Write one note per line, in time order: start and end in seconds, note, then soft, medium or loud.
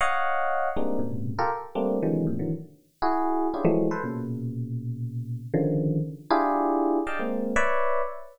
0.01 0.69 C#5 medium
0.01 0.69 D#5 medium
0.01 0.69 F5 medium
0.01 0.69 F#5 medium
0.76 0.99 G3 medium
0.76 0.99 G#3 medium
0.76 0.99 A#3 medium
0.76 0.99 C4 medium
0.76 0.99 D4 medium
0.76 0.99 D#4 medium
0.99 1.33 G#2 soft
0.99 1.33 A#2 soft
0.99 1.33 B2 soft
0.99 1.33 C3 soft
0.99 1.33 C#3 soft
1.39 1.50 F4 medium
1.39 1.50 G4 medium
1.39 1.50 A4 medium
1.39 1.50 A#4 medium
1.75 1.98 G3 medium
1.75 1.98 A3 medium
1.75 1.98 A#3 medium
1.75 1.98 C4 medium
1.75 1.98 D4 medium
2.03 2.25 C3 medium
2.03 2.25 D3 medium
2.03 2.25 D#3 medium
2.03 2.25 E3 medium
2.03 2.25 F#3 medium
2.03 2.25 G#3 medium
2.27 2.38 G#2 medium
2.27 2.38 A2 medium
2.27 2.38 A#2 medium
2.27 2.38 C3 medium
2.39 2.51 D3 medium
2.39 2.51 D#3 medium
2.39 2.51 E3 medium
2.39 2.51 F#3 medium
3.02 3.47 E4 medium
3.02 3.47 F#4 medium
3.02 3.47 G#4 medium
3.54 3.65 C#4 medium
3.54 3.65 D4 medium
3.54 3.65 E4 medium
3.54 3.65 F4 medium
3.54 3.65 G4 medium
3.54 3.65 G#4 medium
3.65 3.87 E3 loud
3.65 3.87 F3 loud
3.65 3.87 F#3 loud
3.65 3.87 G#3 loud
3.65 3.87 A3 loud
3.91 4.02 A4 medium
3.91 4.02 B4 medium
3.91 4.02 C5 medium
4.04 5.40 A#2 medium
4.04 5.40 B2 medium
4.04 5.40 C#3 medium
5.54 5.99 C#3 loud
5.54 5.99 D3 loud
5.54 5.99 D#3 loud
5.54 5.99 F3 loud
6.30 6.99 D4 loud
6.30 6.99 E4 loud
6.30 6.99 F4 loud
6.30 6.99 G4 loud
6.30 6.99 G#4 loud
7.07 7.18 D5 medium
7.07 7.18 D#5 medium
7.07 7.18 F5 medium
7.07 7.18 G5 medium
7.07 7.18 A5 medium
7.19 7.53 G#3 medium
7.19 7.53 A#3 medium
7.19 7.53 C4 medium
7.56 8.01 B4 loud
7.56 8.01 C#5 loud
7.56 8.01 D5 loud
7.56 8.01 E5 loud